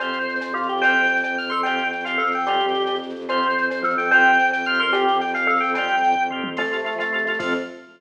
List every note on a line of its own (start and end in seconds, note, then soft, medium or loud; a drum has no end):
0.00 0.10 F2 medium
0.00 0.19 C4 medium
0.00 0.19 F4 medium
0.00 0.19 G4 medium
0.00 0.36 C5 loud
0.00 cowbell medium
0.00 shaker medium
0.08 shaker medium
0.13 0.26 F2 medium
0.13 shaker medium
0.20 shaker medium
0.27 0.38 F2 medium
0.27 shaker medium
0.35 shaker medium
0.40 0.52 F2 medium
0.40 0.52 C5 medium
0.40 cowbell medium
0.40 shaker loud
0.47 shaker medium
0.54 0.66 F2 medium
0.54 0.67 F4 medium
0.54 0.80 G4 medium
0.54 shaker medium
0.63 shaker medium
0.68 0.81 F2 medium
0.68 0.82 G4 medium
0.68 shaker medium
0.77 shaker medium
0.82 0.94 F2 medium
0.82 1.02 C4 medium
0.82 1.02 F4 medium
0.82 1.02 G4 medium
0.82 1.48 C5 loud
0.82 1.17 G5 loud
0.82 cowbell medium
0.82 shaker medium
0.89 shaker medium
0.95 1.06 F2 medium
0.95 shaker medium
1.03 shaker medium
1.08 1.21 F2 medium
1.08 shaker medium
1.16 shaker medium
1.23 1.36 F2 medium
1.23 1.35 G5 medium
1.23 cowbell medium
1.23 shaker medium
1.38 1.50 F2 medium
1.38 1.52 F6 loud
1.38 shaker medium
1.44 shaker medium
1.50 1.62 F2 medium
1.50 1.63 A4 medium
1.50 1.61 C6 medium
1.50 shaker medium
1.56 shaker medium
1.63 1.78 F2 medium
1.63 1.84 C4 medium
1.63 1.84 F4 medium
1.63 1.88 G5 loud
1.63 cowbell medium
1.63 shaker medium
1.67 1.84 G4 medium
1.67 shaker medium
1.78 1.91 F2 medium
1.78 shaker medium
1.84 shaker medium
1.91 2.04 F2 medium
1.91 2.02 G5 medium
1.91 shaker medium
2.00 shaker medium
2.04 2.16 F2 medium
2.04 2.23 C4 medium
2.04 2.23 F4 medium
2.04 2.23 G4 medium
2.04 2.29 F5 medium
2.04 cowbell medium
2.04 shaker medium
2.11 shaker soft
2.18 2.31 F2 medium
2.18 2.41 A4 loud
2.18 shaker medium
2.26 shaker medium
2.32 2.44 F2 medium
2.32 2.46 G5 medium
2.32 shaker medium
2.39 shaker medium
2.45 2.57 F2 medium
2.45 2.84 G3 medium
2.45 2.66 C4 loud
2.45 2.66 F4 medium
2.45 2.95 G4 loud
2.45 cowbell medium
2.45 shaker medium
2.50 2.66 G4 medium
2.50 shaker medium
2.60 2.73 F2 medium
2.60 shaker medium
2.68 shaker medium
2.74 2.87 F2 medium
2.74 shaker medium
2.80 shaker medium
2.86 2.99 F2 medium
2.86 cowbell medium
2.86 shaker medium
2.95 shaker medium
3.01 3.13 F2 medium
3.01 shaker medium
3.09 3.25 F2 medium
3.09 shaker medium
3.16 shaker medium
3.21 shaker medium
3.28 3.39 F2 loud
3.28 3.48 C4 loud
3.28 3.48 F4 medium
3.28 3.48 G4 medium
3.28 3.65 C5 loud
3.28 cowbell medium
3.28 shaker medium
3.36 shaker medium
3.42 3.54 F2 medium
3.42 shaker medium
3.49 shaker medium
3.56 3.68 F2 medium
3.56 shaker medium
3.62 shaker medium
3.70 3.82 F2 medium
3.70 3.83 C5 medium
3.70 cowbell medium
3.70 shaker medium
3.76 shaker medium
3.82 3.95 F2 medium
3.82 3.95 F3 loud
3.82 4.11 A4 loud
3.82 shaker medium
3.90 shaker medium
3.97 4.09 F2 medium
3.97 4.10 G5 loud
3.97 shaker medium
4.04 shaker medium
4.11 4.23 F2 loud
4.11 4.31 C4 medium
4.11 4.31 F4 medium
4.11 4.31 G4 medium
4.11 4.78 C5 loud
4.11 4.47 G5 loud
4.11 cowbell medium
4.11 shaker medium
4.19 shaker medium
4.24 4.37 F2 medium
4.24 shaker medium
4.32 shaker medium
4.39 4.50 F2 medium
4.39 shaker medium
4.46 shaker medium
4.51 4.63 F2 medium
4.51 4.65 G5 loud
4.51 cowbell medium
4.51 shaker medium
4.59 shaker medium
4.64 4.78 F2 medium
4.64 4.86 C4 medium
4.64 4.86 F4 medium
4.64 4.80 F6 loud
4.64 shaker medium
4.70 4.86 G4 medium
4.70 shaker medium
4.79 4.91 F2 medium
4.79 4.92 A#4 loud
4.79 4.91 C6 loud
4.79 shaker medium
4.87 shaker medium
4.92 5.04 F2 medium
4.92 5.12 C4 medium
4.92 5.12 F4 medium
4.92 5.18 G4 loud
4.92 5.12 G4 medium
4.92 cowbell medium
4.92 shaker medium
5.00 shaker medium
5.08 5.20 F2 medium
5.08 shaker medium
5.13 shaker medium
5.21 5.33 F2 medium
5.21 5.32 G5 loud
5.21 shaker medium
5.28 shaker medium
5.34 5.45 F2 medium
5.34 5.58 F5 loud
5.34 cowbell medium
5.34 shaker medium
5.42 shaker medium
5.46 5.58 F2 medium
5.46 5.70 A4 loud
5.46 shaker medium
5.56 shaker medium
5.60 5.74 F2 medium
5.60 5.71 G5 loud
5.60 shaker medium
5.68 shaker medium
5.74 5.86 F2 medium
5.74 6.12 G3 loud
5.74 5.96 C4 medium
5.74 5.96 F4 medium
5.74 6.23 G5 loud
5.74 cowbell medium
5.74 shaker medium
5.79 5.96 G4 medium
5.79 shaker medium
5.88 6.01 F2 medium
5.88 shaker medium
5.97 shaker medium
6.02 6.13 F2 medium
6.02 shaker medium
6.11 shaker medium
6.16 6.28 F2 medium
6.16 kick medium
6.29 6.40 F2 medium
6.29 6.50 C4 medium
6.29 6.50 F4 medium
6.29 mid tom medium
6.33 6.50 G4 medium
6.43 6.55 F2 medium
6.43 high tom loud
6.56 6.62 F2 medium
6.56 7.38 F3 loud
6.56 6.95 A3 loud
6.56 6.62 C4 loud
6.56 6.62 F4 loud
6.56 6.63 A4 loud
6.56 crash medium
6.56 cowbell medium
6.64 6.72 F2 medium
6.64 shaker medium
6.71 6.78 C3 medium
6.71 6.77 C4 medium
6.71 6.77 F4 medium
6.71 6.77 A4 medium
6.71 shaker medium
6.78 shaker medium
6.85 6.90 C4 medium
6.85 6.90 F4 medium
6.85 6.90 A4 medium
6.85 shaker medium
6.92 6.98 F3 medium
6.92 shaker medium
6.98 7.04 F2 medium
6.98 7.25 A3 loud
6.98 7.04 C4 loud
6.98 7.04 F4 medium
6.98 7.04 A4 medium
6.98 cowbell medium
6.98 shaker medium
7.05 shaker medium
7.12 7.18 C3 medium
7.12 7.18 C4 loud
7.12 7.18 F4 medium
7.12 7.18 A4 loud
7.12 shaker medium
7.18 7.27 F2 medium
7.18 shaker medium
7.25 7.32 C3 medium
7.25 7.38 A3 loud
7.25 7.32 C4 medium
7.25 7.32 F4 loud
7.25 shaker medium
7.30 7.33 A4 medium
7.30 shaker medium
7.39 7.54 F2 loud
7.39 7.53 F3 loud
7.39 7.54 F3 loud
7.39 7.54 C4 loud
7.39 7.54 F4 medium
7.39 7.54 A4 medium
7.39 kick loud
7.39 crash loud